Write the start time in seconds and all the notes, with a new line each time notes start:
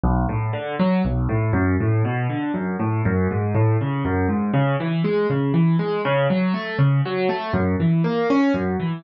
0.04 B1
0.29 A2
0.53 D3
0.79 F#3
1.05 B1
1.29 A2
1.53 F#2
1.80 A2
2.05 B2
2.30 D3
2.54 F#2
2.79 A2
3.05 F#2
3.31 G#2
3.55 A2
3.81 C#3
4.05 F#2
4.29 G#2
4.54 C#3
4.80 E3
5.04 G#3
5.30 C#3
5.54 E3
5.79 G#3
6.05 C#3
6.30 F#3
6.54 A3
6.79 C#3
7.05 F#3
7.29 A3
7.53 F#2
7.80 E3
8.04 A#3
8.30 C#4
8.54 F#2
8.80 E3